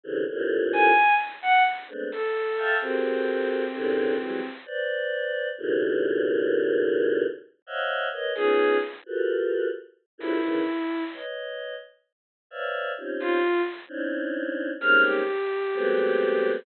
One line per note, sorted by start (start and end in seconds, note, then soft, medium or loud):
0.03 0.24 C3 loud
0.03 0.24 C#3 loud
0.03 0.24 D3 loud
0.03 0.24 E3 loud
0.29 0.91 F2 loud
0.29 0.91 G2 loud
0.29 0.91 A2 loud
0.29 0.91 A#2 loud
0.73 1.14 G#5 loud
1.42 1.63 F#5 loud
1.88 2.09 G#3 medium
1.88 2.09 A3 medium
1.88 2.09 B3 medium
1.88 2.09 C4 medium
1.88 2.09 D4 medium
2.12 2.74 A4 medium
2.57 2.78 E5 medium
2.57 2.78 F5 medium
2.57 2.78 G5 medium
2.57 2.78 A5 medium
2.81 4.48 C4 medium
2.81 3.64 F#4 medium
2.81 3.64 G4 medium
2.81 3.64 G#4 medium
2.81 3.64 A4 medium
2.81 3.64 A#4 medium
2.81 3.64 C5 medium
3.74 4.16 F#2 loud
3.74 4.16 G#2 loud
3.74 4.16 A2 loud
3.74 4.16 B2 loud
3.74 4.16 C3 loud
3.74 4.16 D3 loud
4.19 4.40 E3 medium
4.19 4.40 F#3 medium
4.19 4.40 G3 medium
4.19 4.40 G#3 medium
4.66 5.49 B4 medium
4.66 5.49 C5 medium
4.66 5.49 D5 medium
5.58 7.24 G2 loud
5.58 7.24 A2 loud
5.58 7.24 A#2 loud
5.58 7.24 B2 loud
5.58 7.24 C#3 loud
5.58 7.24 D#3 loud
7.67 8.08 C5 medium
7.67 8.08 C#5 medium
7.67 8.08 D#5 medium
7.67 8.08 E5 medium
7.67 8.08 F5 medium
7.67 8.08 F#5 medium
8.12 8.33 A#4 medium
8.12 8.33 B4 medium
8.12 8.33 C#5 medium
8.12 8.33 D#5 medium
8.35 8.78 B3 medium
8.35 8.78 C#4 medium
8.35 8.78 D#4 medium
8.35 8.78 F4 medium
8.35 8.77 G#4 loud
9.06 9.68 F4 medium
9.06 9.68 F#4 medium
9.06 9.68 G4 medium
9.06 9.68 A4 medium
9.06 9.68 A#4 medium
9.06 9.68 B4 medium
10.18 10.39 F2 medium
10.18 10.39 F#2 medium
10.18 10.39 G2 medium
10.18 10.39 G#2 medium
10.18 10.39 A#2 medium
10.18 11.03 E4 medium
10.42 10.63 C#3 medium
10.42 10.63 D#3 medium
10.42 10.63 E3 medium
11.13 11.75 B4 medium
11.13 11.75 C#5 medium
11.13 11.75 D#5 medium
12.51 12.92 B4 medium
12.51 12.92 C5 medium
12.51 12.92 C#5 medium
12.51 12.92 D5 medium
12.51 12.92 E5 medium
12.51 12.92 F5 medium
12.98 13.39 C4 medium
12.98 13.39 C#4 medium
12.98 13.39 D#4 medium
12.98 13.39 F4 medium
12.98 13.39 G4 medium
13.20 13.62 F4 loud
13.88 14.71 C4 medium
13.88 14.71 C#4 medium
13.88 14.71 D4 medium
13.88 14.71 D#4 medium
13.88 14.71 E4 medium
14.80 15.22 G3 medium
14.80 15.22 G#3 medium
14.80 15.22 A#3 medium
14.80 15.22 C4 medium
14.80 15.22 C#4 medium
14.80 15.22 D#4 medium
14.80 15.02 F6 medium
15.04 16.49 G4 medium
15.74 16.57 F#3 loud
15.74 16.57 G#3 loud
15.74 16.57 A3 loud
15.74 16.57 B3 loud
15.74 16.57 C4 loud